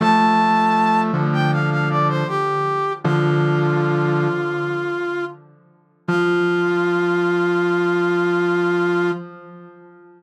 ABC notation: X:1
M:4/4
L:1/16
Q:1/4=79
K:F
V:1 name="Brass Section"
a6 z g f f d c G4 | F14 z2 | F16 |]
V:2 name="Brass Section"
[F,A,]6 [D,F,]6 z4 | [D,F,]8 z8 | F,16 |]